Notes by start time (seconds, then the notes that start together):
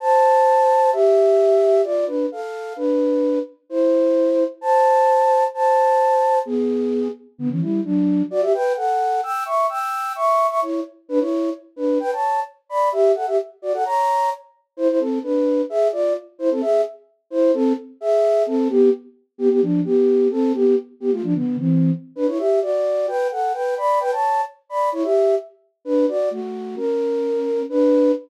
0.00 C5 A5
0.93 G4 E5
1.84 F4 D5
2.07 D4 B4
2.32 A4 F5
2.76 D4 B4
3.70 E4 C5
4.61 C5 A5
5.54 C5 A5
6.45 B3 G#4
7.38 D3 B3
7.50 E3 C#4
7.61 G3 E4
7.84 F#3 D4
8.30 F#4 D5
8.42 G4 E5
8.54 B4 G5
8.76 A4 F#5
9.23 G5 E6
9.45 E5 C#6
9.69 G5 E6
10.15 E5 C#6
10.49 E5 C#6
10.62 E4 C#5
11.09 D4 B4
11.20 E4 C#5
11.76 D4 B4
12.00 B4 G5
12.12 C#5 A5
12.69 D5 B5
12.92 G4 E5
13.15 A4 F#5
13.27 G4 E5
13.62 F#4 D5
13.73 A4 F#5
13.85 C#5 A#5
14.77 E4 C5
14.88 E4 C5
15.00 C4 A4
15.23 D4 B4
15.70 G#4 E5
15.92 F4 D5
16.39 E4 C5
16.51 C4 A4
16.61 G#4 E5
17.30 E4 C5
17.54 C4 A4
18.01 G#4 E5
18.46 C4 A4
18.69 B3 G4
19.38 B3 G4
19.50 B3 G4
19.62 F3 D4
19.85 B3 G4
20.31 C4 A4
20.54 B3 G4
21.00 B3 G4
21.12 A3 F4
21.23 F3 D4
21.35 D3 B3
21.58 E3 C4
22.16 D4 B4
22.27 E4 C#5
22.38 G4 E5
22.62 F#4 D5
23.08 B4 G5
23.31 A4 F#5
23.53 B4 G5
23.77 D5 B5
24.00 B4 G5
24.11 C#5 A5
24.69 D5 B5
24.92 E4 C#5
25.03 G4 E5
25.85 D4 B4
26.08 F#4 D5
26.31 A3 F#4
26.76 C#4 A#4
27.69 D4 B4